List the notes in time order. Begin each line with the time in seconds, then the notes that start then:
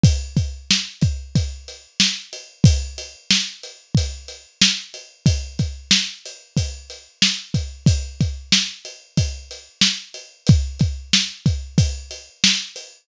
0.04 kick, closed hi-hat
0.37 kick, closed hi-hat
0.71 snare
1.01 kick, closed hi-hat
1.35 kick, closed hi-hat
1.68 closed hi-hat
2.00 snare
2.33 closed hi-hat
2.64 kick, closed hi-hat
2.98 closed hi-hat
3.31 snare
3.63 closed hi-hat
3.95 kick, closed hi-hat
4.28 closed hi-hat
4.62 snare
4.94 closed hi-hat
5.26 kick, closed hi-hat
5.59 kick, closed hi-hat
5.91 snare
6.25 closed hi-hat
6.57 kick, closed hi-hat
6.90 closed hi-hat
7.22 snare
7.54 kick, closed hi-hat
7.86 kick, closed hi-hat
8.21 kick, closed hi-hat
8.52 snare
8.85 closed hi-hat
9.17 kick, closed hi-hat
9.51 closed hi-hat
9.81 snare
10.14 closed hi-hat
10.47 kick, closed hi-hat
10.79 kick, closed hi-hat
11.13 snare
11.46 kick, closed hi-hat
11.78 kick, closed hi-hat
12.11 closed hi-hat
12.44 snare
12.76 closed hi-hat